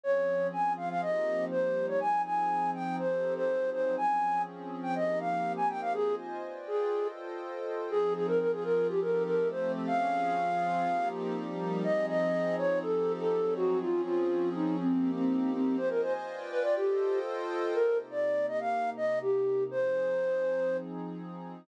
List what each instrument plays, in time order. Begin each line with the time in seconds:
0.03 pad 2 (warm) F3 C4 C#4 G#4, flute C#5
0.53 pad 2 (warm) F3 C4 F4 G#4, flute G#5
0.77 flute F5
0.90 flute F5
1.02 pad 2 (warm) F3 A#3 C4 D#4 G4, flute D#5
1.51 pad 2 (warm) F3 G3 A#3 D#4 G4, flute C5
1.88 flute C#5
2.00 pad 2 (warm) F3 C4 D#4 G#4, flute G#5
2.25 flute G#5
2.74 flute G5
2.99 pad 2 (warm) F3 C4 D#4 G4 A4, flute C5
3.36 flute C5
3.48 pad 2 (warm) F3 F#3 C4 D#4 G#4
3.72 flute C5
3.97 pad 2 (warm) F3 C4 C#4 G#4, flute G#5
4.83 flute G5
4.95 pad 2 (warm) F3 A#3 C4 D#4 G4, flute D#5
5.20 flute F5
5.57 flute G#5
5.69 flute G5
5.81 flute F5
5.94 pad 2 (warm) F4 C5 D#5 G#5, flute G#4
6.43 pad 2 (warm) F4 B4 D5 G5
6.67 flute G#4
6.92 pad 2 (warm) F4 A4 C5 D#5 G5
7.90 pad 2 (warm) F3 C4 D#4 G#4, flute G#4
8.15 flute G#4
8.27 flute A#4
8.40 pad 2 (warm) F3 C4 F4 G#4, flute A#4
8.52 flute G#4
8.64 flute A#4
8.89 pad 2 (warm) F3 C4 D#4 G4 A4, flute G4
9.01 flute A#4
9.26 flute A#4
9.38 pad 2 (warm) F3 A3 C4 G4 A4
9.50 flute C5
9.87 pad 2 (warm) F3 C4 C#4 G#4, flute F5
10.36 pad 2 (warm) F3 C4 F4 G#4
10.86 pad 2 (warm) F3 A#3 C4 D#4 G4
11.35 pad 2 (warm) F3 G3 A#3 D#4 G4
11.84 pad 2 (warm) F3 C4 D#4 G#4, flute D#5
12.09 flute D#5
12.58 flute C#5
12.82 pad 2 (warm) F3 C4 D#4 G4 A4, flute A4
13.19 flute A4
13.31 pad 2 (warm) F3 F#3 C4 D#4 G#4
13.56 flute F#4
13.81 pad 2 (warm) F3 C4 C#4 G#4, flute F4
14.05 flute F4
14.54 flute D#4
14.79 pad 2 (warm) F3 A#3 C4 D#4 G4, flute C4
15.16 flute C4
15.53 flute C4
15.77 pad 2 (warm) F4 C5 D#5 G#5, flute C5
15.90 flute A#4
16.02 flute C5
16.27 pad 2 (warm) F4 B4 D5 G5
16.51 flute B4
16.63 flute D5
16.76 pad 2 (warm) F4 A4 C5 D#5 G5, flute G4
17.74 pad 2 (warm) C3 A#3 D#4 G4, flute A#4
18.11 flute D5
18.48 flute D#5
18.60 flute F5
18.97 flute D#5
19.22 flute G4
19.71 pad 2 (warm) F3 C4 D#4 G#4, flute C5